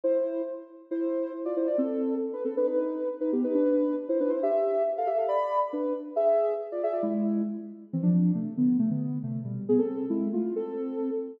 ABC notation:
X:1
M:2/4
L:1/16
Q:1/4=137
K:Am
V:1 name="Ocarina"
[Ec]4 z4 | [Ec]4 z [Fd] [Ec] [Fd] | [CA]4 z [DB] [CA] [DB] | [^DB]4 z [DB] [B,G] [DB] |
[DB]4 z [Ec] [DB] [Ec] | [Ge]4 z [Af] [Ge] [Af] | [db]3 z [DB]2 z2 | [^Ge]4 z [Fd] [Ge] [Fd] |
[^G,E]4 z4 | [E,C] [F,D]3 [C,A,]2 [D,B,]2 | [C,A,] [D,B,]3 [C,A,]2 [B,,G,]2 | [B,^G] [CA]3 [^G,E]2 [A,F]2 |
[CA]6 z2 |]